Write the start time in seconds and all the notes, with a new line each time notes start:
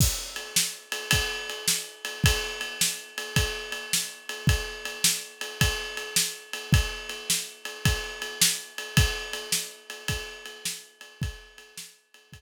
0.00 kick, crash
0.36 ride
0.56 snare
0.92 ride
1.11 kick, ride
1.50 ride
1.68 snare
2.05 ride
2.24 kick, ride
2.61 ride
2.81 snare
3.18 ride
3.36 kick, ride
3.72 ride
3.93 snare
4.29 ride
4.47 kick, ride
4.85 ride
5.04 snare
5.41 ride
5.61 kick, ride
5.97 ride
6.16 snare
6.53 ride
6.73 kick, ride
7.09 ride
7.30 snare
7.65 ride
7.85 kick, ride
8.22 ride
8.41 snare
8.78 ride
8.97 kick, ride
9.33 ride
9.52 snare
9.90 ride
10.08 kick, ride
10.46 ride
10.65 snare
11.01 ride
11.22 kick, ride
11.58 ride
11.77 snare
12.14 ride
12.33 kick, ride